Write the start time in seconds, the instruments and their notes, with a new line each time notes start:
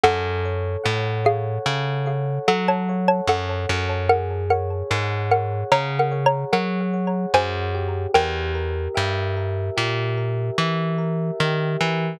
0.04 electric bass (finger) F#2, xylophone A4 F#5, electric piano 1 A4
0.45 electric piano 1 C#5
0.84 electric bass (finger) A2, electric piano 1 F#5
1.25 xylophone G#4 F5, electric piano 1 C#5
1.66 electric bass (finger) C#3, electric piano 1 A4
2.06 electric piano 1 C#5
2.48 electric bass (finger) F#3, xylophone A4 F#5, electric piano 1 F#5
2.68 xylophone C#5 A5
2.89 electric piano 1 C#5
3.08 xylophone C#5 A5
3.28 electric bass (finger) F#2, electric piano 1 A4, xylophone A4 F#5
3.69 electric bass (finger) F#2, electric piano 1 C#5
4.09 electric piano 1 G#4, xylophone A#4 F#5
4.50 xylophone A#4 F#5, electric piano 1 C#5
4.91 electric bass (finger) G#2, electric piano 1 F#5
5.31 xylophone A#4 F#5, electric piano 1 C#5
5.72 electric bass (finger) C#3, electric piano 1 G#4, xylophone C#5 A#5
5.99 xylophone A#4 F#5
6.11 electric piano 1 C#5
6.26 xylophone C#5 A#5
6.52 electric bass (finger) F#3, xylophone A#4 F#5, electric piano 1 F#5
6.93 electric piano 1 C#5
7.34 electric bass (finger) F#2, electric piano 1 G#4, xylophone C5 G#5
7.74 electric piano 1 G4
8.14 electric bass (finger) E2, xylophone A#4 G5
8.55 electric piano 1 A#4
8.94 electric bass (finger) G2, electric piano 1 E5
9.37 electric piano 1 A#4
9.77 electric bass (finger) A#2, electric piano 1 G4
10.17 electric piano 1 A#4
10.58 electric bass (finger) E3, electric piano 1 E5
10.98 electric piano 1 A#4
11.40 electric bass (finger) D#3, electric piano 1 G4
11.80 electric bass (finger) E3, electric piano 1 A#4